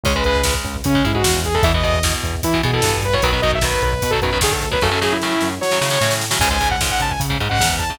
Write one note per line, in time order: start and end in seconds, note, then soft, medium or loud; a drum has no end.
0.03 0.54 C#2 medium
0.03 0.13 C#3 medium
0.03 0.13 G#3 loud
0.03 0.15 C#5 loud
0.03 kick loud
0.03 crash loud
0.15 0.24 C#3 loud
0.15 0.24 G#3 loud
0.15 0.24 B4 medium
0.15 kick medium
0.24 0.42 C#3 loud
0.24 0.42 G#3 medium
0.24 0.54 B4 loud
0.24 kick medium
0.24 closed hi-hat medium
0.35 kick medium
0.43 0.77 C#3 medium
0.43 0.77 G#3 medium
0.43 kick medium
0.43 snare loud
0.54 kick medium
0.64 0.81 C#2 medium
0.64 kick medium
0.64 closed hi-hat medium
0.76 kick medium
0.84 1.02 C#3 medium
0.84 1.04 C#4 loud
0.84 kick loud
0.84 closed hi-hat loud
0.95 1.03 C#3 medium
0.95 1.03 G#3 medium
0.95 kick medium
1.04 1.23 G#2 medium
1.04 1.12 C#3 medium
1.04 1.12 G#3 medium
1.04 1.15 E4 loud
1.04 kick medium
1.04 closed hi-hat medium
1.13 1.23 C#3 medium
1.13 1.23 G#3 medium
1.13 1.40 F#4 medium
1.13 kick loud
1.24 1.58 E2 medium
1.24 1.48 C#3 medium
1.24 1.48 G#3 medium
1.24 kick loud
1.24 snare loud
1.34 kick medium
1.44 1.55 G#4 loud
1.44 kick medium
1.44 closed hi-hat medium
1.55 1.63 C#3 medium
1.55 1.63 G#3 medium
1.55 1.64 A4 loud
1.55 kick medium
1.63 2.14 E2 medium
1.63 1.72 B2 loud
1.63 1.72 E3 loud
1.63 1.73 E5 loud
1.63 kick loud
1.63 closed hi-hat loud
1.74 1.82 B2 medium
1.74 1.82 E3 medium
1.74 1.84 D#5 medium
1.74 kick medium
1.83 1.99 B2 loud
1.83 1.99 E3 medium
1.83 2.13 D#5 medium
1.83 kick medium
1.83 closed hi-hat medium
1.94 kick medium
2.03 2.35 B2 medium
2.03 2.35 E3 medium
2.03 kick loud
2.03 snare loud
2.13 kick medium
2.23 2.41 E2 medium
2.23 kick medium
2.23 closed hi-hat medium
2.35 kick medium
2.43 2.61 E3 medium
2.43 2.62 E4 medium
2.43 kick loud
2.43 closed hi-hat loud
2.54 2.62 B2 medium
2.54 2.62 E3 medium
2.54 kick medium
2.63 2.71 B2 loud
2.63 2.81 B2 medium
2.63 2.71 E3 loud
2.63 2.74 G#4 medium
2.63 kick medium
2.63 closed hi-hat medium
2.73 2.81 B2 medium
2.73 2.81 E3 medium
2.73 3.01 A4 loud
2.73 kick medium
2.82 3.16 G2 medium
2.82 3.07 B2 medium
2.82 3.07 E3 medium
2.82 kick medium
2.82 snare loud
2.94 kick medium
3.02 3.14 B4 loud
3.02 kick medium
3.02 closed hi-hat medium
3.13 3.21 B2 medium
3.13 3.21 E3 medium
3.13 3.23 C#5 medium
3.13 kick medium
3.22 3.74 B1 medium
3.22 3.31 B2 loud
3.22 3.31 D#3 loud
3.22 3.31 F#3 loud
3.22 3.41 B4 loud
3.22 kick medium
3.22 closed hi-hat loud
3.32 3.40 B2 medium
3.32 3.40 D#3 medium
3.32 3.40 F#3 medium
3.32 kick medium
3.42 3.59 B2 medium
3.42 3.59 D#3 medium
3.42 3.59 F#3 medium
3.42 3.51 D#5 loud
3.42 kick medium
3.42 closed hi-hat medium
3.52 3.64 E5 loud
3.52 kick medium
3.61 3.94 B2 medium
3.61 3.94 D#3 medium
3.61 3.94 F#3 medium
3.61 3.82 B4 medium
3.61 kick loud
3.61 snare loud
3.74 kick medium
3.82 3.99 B1 medium
3.82 4.11 B4 loud
3.82 kick medium
3.82 closed hi-hat medium
3.93 kick medium
4.02 4.20 B2 medium
4.02 kick loud
4.02 closed hi-hat loud
4.11 4.20 B2 medium
4.11 4.20 D#3 medium
4.11 4.20 F#3 medium
4.11 4.20 A4 loud
4.11 kick medium
4.22 4.39 F#2 medium
4.22 4.31 B2 medium
4.22 4.31 D#3 medium
4.22 4.31 F#3 medium
4.22 4.38 B4 loud
4.22 kick medium
4.22 closed hi-hat medium
4.33 4.40 B2 medium
4.33 4.40 D#3 medium
4.33 4.40 F#3 medium
4.33 kick medium
4.41 4.76 D2 medium
4.41 4.65 B2 medium
4.41 4.65 D#3 medium
4.41 4.65 F#3 medium
4.41 4.53 G#4 medium
4.41 kick loud
4.41 snare loud
4.52 4.68 A4 medium
4.52 kick loud
4.62 kick medium
4.62 closed hi-hat medium
4.71 4.79 B2 medium
4.71 4.79 D#3 medium
4.71 4.79 F#3 medium
4.71 4.82 B4 medium
4.71 kick loud
4.81 5.34 F#2 medium
4.81 4.90 A2 loud
4.81 4.90 C#3 loud
4.81 4.90 F#3 loud
4.81 5.00 A4 loud
4.81 kick loud
4.81 snare medium
4.91 4.99 A2 loud
4.91 4.99 C#3 medium
4.91 4.99 F#3 medium
5.01 5.17 A2 loud
5.01 5.17 C#3 medium
5.01 5.17 F#3 medium
5.01 5.13 G#4 medium
5.01 snare medium
5.13 5.50 E4 loud
5.22 5.54 A2 medium
5.22 5.54 C#3 medium
5.22 5.54 F#3 medium
5.22 snare medium
5.41 5.59 F#2 medium
5.41 snare medium
5.61 5.79 F#3 medium
5.61 6.15 C#5 loud
5.61 snare medium
5.71 5.80 A2 medium
5.71 5.80 C#3 medium
5.71 5.80 F#3 medium
5.71 snare medium
5.81 5.89 A2 medium
5.81 5.98 C#3 medium
5.81 5.89 C#3 medium
5.81 5.89 F#3 medium
5.81 snare loud
5.90 5.99 A2 loud
5.90 5.99 C#3 medium
5.90 5.99 F#3 medium
5.90 snare medium
6.01 6.35 A2 medium
6.01 6.25 A2 loud
6.01 6.25 C#3 medium
6.01 6.25 F#3 medium
6.01 snare medium
6.11 snare loud
6.21 snare medium
6.31 6.39 A2 medium
6.31 6.39 C#3 loud
6.31 6.39 F#3 medium
6.31 snare loud
6.39 6.90 C#2 medium
6.39 6.49 G#2 loud
6.39 6.49 C#3 loud
6.39 6.49 G#5 loud
6.39 kick loud
6.39 crash loud
6.50 6.58 G#2 loud
6.50 6.58 C#3 medium
6.50 6.69 G#5 loud
6.50 kick medium
6.60 6.76 G#2 medium
6.60 6.76 C#3 medium
6.60 kick medium
6.60 closed hi-hat medium
6.71 6.80 F#5 loud
6.71 kick loud
6.81 7.13 G#2 medium
6.81 7.13 C#3 medium
6.81 kick medium
6.81 snare loud
6.90 7.01 F#5 medium
6.90 kick medium
7.00 7.17 C#2 medium
7.00 7.11 A5 loud
7.00 kick medium
7.00 closed hi-hat medium
7.11 7.20 G#5 loud
7.11 kick medium
7.20 7.37 C#3 medium
7.20 kick medium
7.20 closed hi-hat loud
7.30 7.38 G#2 loud
7.30 7.38 C#3 medium
7.30 kick medium
7.39 7.48 G#2 loud
7.39 7.57 G#2 medium
7.39 7.48 C#3 medium
7.39 kick medium
7.39 closed hi-hat medium
7.49 7.59 G#2 medium
7.49 7.59 C#3 medium
7.49 7.76 F#5 loud
7.49 kick medium
7.59 7.94 E2 medium
7.59 7.84 G#2 medium
7.59 7.84 C#3 medium
7.59 kick loud
7.59 snare loud
7.70 kick medium
7.79 7.95 A5 medium
7.79 kick medium
7.79 closed hi-hat medium
7.90 7.98 G#2 medium
7.90 7.98 C#3 medium
7.90 kick medium